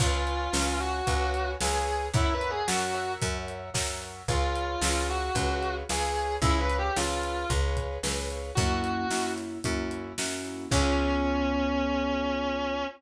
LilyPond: <<
  \new Staff \with { instrumentName = "Distortion Guitar" } { \time 4/4 \key des \major \tempo 4 = 112 f'4. ges'4. aes'4 | \tuplet 3/2 { fes'8 b'8 aes'8 } ges'4 r2 | f'4. ges'4. aes'4 | \tuplet 3/2 { e'8 ces''8 g'8 } f'4 r2 |
ges'4. r2 r8 | des'1 | }
  \new Staff \with { instrumentName = "Acoustic Grand Piano" } { \time 4/4 \key des \major <ces'' des'' f'' aes''>4 <ces'' des'' f'' aes''>4 <ces'' des'' f'' aes''>4 <ces'' des'' f'' aes''>4 | <bes' des'' fes'' ges''>4 <bes' des'' fes'' ges''>8 <bes' des'' fes'' ges''>4. <bes' des'' fes'' ges''>4 | <aes' ces'' des'' f''>4 <aes' ces'' des'' f''>4 <aes' ces'' des'' f''>4 <aes' ces'' des'' f''>4 | <aes' ces'' des'' f''>4 <aes' ces'' des'' f''>4 <aes' ces'' des'' f''>4 <aes' ces'' des'' f''>4 |
<bes des' fes' ges'>4 <bes des' fes' ges'>4 <bes des' fes' ges'>4 <bes des' fes' ges'>4 | <ces' des' f' aes'>1 | }
  \new Staff \with { instrumentName = "Electric Bass (finger)" } { \clef bass \time 4/4 \key des \major des,4 des,4 des,4 des,4 | ges,4 ges,4 ges,4 ges,4 | des,4 des,4 des,4 des,4 | des,4 des,4 des,4 des,4 |
ges,4 ges,4 ges,4 ges,4 | des,1 | }
  \new DrumStaff \with { instrumentName = "Drums" } \drummode { \time 4/4 <cymc bd>8 hh8 sn8 hh8 <hh bd>8 hh8 sn8 hh8 | <hh bd>8 hh8 sn8 hh8 <hh bd>8 hh8 <bd sn>8 hh8 | <hh bd>8 hh8 sn8 hh8 <hh bd>8 hh8 sn8 hh8 | <hh bd>8 hh8 sn8 hh8 <hh bd>8 <hh bd>8 sn8 hh8 |
<hh bd>8 hh8 sn8 hh8 <hh bd>8 hh8 sn8 hh8 | <cymc bd>4 r4 r4 r4 | }
>>